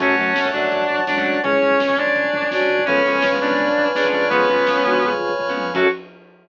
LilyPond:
<<
  \new Staff \with { instrumentName = "Distortion Guitar" } { \time 4/4 \key fis \minor \tempo 4 = 167 <cis' cis''>4. <d' d''>4. <d' d''>4 | <cis' cis''>4. <d' d''>4. <d' d''>4 | <cis' cis''>4. <d' d''>4. <d' d''>4 | <b b'>2~ <b b'>8 r4. |
fis'4 r2. | }
  \new Staff \with { instrumentName = "Flute" } { \time 4/4 \key fis \minor <fis a>4 r2 <e gis>4 | <e' gis'>4 r2 <d' fis'>4 | <a' cis''>4 r2 <gis' b'>4 | <eis' gis'>8 <cis' eis'>4 <d' fis'>8 <eis' gis'>4 r4 |
fis'4 r2. | }
  \new Staff \with { instrumentName = "Acoustic Guitar (steel)" } { \time 4/4 \key fis \minor <fis a cis'>8 <fis a cis'>8. <fis a cis'>16 <fis a cis'>4.~ <fis a cis'>16 <fis a cis'>8. | <gis cis'>8 <gis cis'>8. <gis cis'>16 <gis cis'>4.~ <gis cis'>16 <gis cis'>8. | <eis gis b cis'>8 <eis gis b cis'>8. <eis gis b cis'>16 <eis gis b cis'>4.~ <eis gis b cis'>16 <eis gis b cis'>8. | <eis gis b cis'>8 <eis gis b cis'>8. <eis gis b cis'>16 <eis gis b cis'>4.~ <eis gis b cis'>16 <eis gis b cis'>8. |
<fis a cis'>4 r2. | }
  \new Staff \with { instrumentName = "Drawbar Organ" } { \time 4/4 \key fis \minor <cis'' fis'' a''>1 | <cis'' gis''>1 | <b' cis'' eis'' gis''>2.~ <b' cis'' eis'' gis''>8 <b' cis'' eis'' gis''>8~ | <b' cis'' eis'' gis''>1 |
<cis' fis' a'>4 r2. | }
  \new Staff \with { instrumentName = "Synth Bass 1" } { \clef bass \time 4/4 \key fis \minor fis,8 fis,8 fis,8 fis,8 fis,8 fis,8 fis,8 fis,8 | cis,8 cis,8 cis,8 cis,8 cis,8 cis,8 cis,8 cis,8 | cis,8 cis,8 cis,8 cis,8 cis,8 cis,8 cis,8 eis,8~ | eis,8 eis,8 eis,8 eis,8 eis,8 eis,8 eis,8 eis,8 |
fis,4 r2. | }
  \new Staff \with { instrumentName = "Pad 2 (warm)" } { \time 4/4 \key fis \minor <cis'' fis'' a''>1 | <cis'' gis''>1 | <b' cis'' eis'' gis''>1 | <b' cis'' eis'' gis''>1 |
<cis' fis' a'>4 r2. | }
  \new DrumStaff \with { instrumentName = "Drums" } \drummode { \time 4/4 <cymc bd>16 bd16 <hh bd>16 bd16 <bd sn>16 bd16 <hh bd>16 bd16 <hh bd>16 bd16 <hh bd>16 bd16 <bd sn>16 bd16 <hh bd>16 bd16 | <hh bd>16 bd16 <hh bd>16 bd16 <bd sn>16 bd16 <hh bd>16 bd16 <hh bd>16 bd16 <hh bd>16 bd16 <bd sn>16 bd16 <hh bd>16 bd16 | <hh bd>16 bd16 <hh bd>16 bd16 <bd sn>16 bd16 <hh bd>16 bd16 <hh bd>16 bd16 <hh bd>16 bd16 <bd sn>16 bd16 <hh bd>16 bd16 | <hh bd>16 bd16 <hh bd>16 bd16 <bd sn>16 bd16 <hh bd>16 bd16 <hh bd>16 bd16 <hh bd>16 bd16 <bd tomfh>8 tommh8 |
<cymc bd>4 r4 r4 r4 | }
>>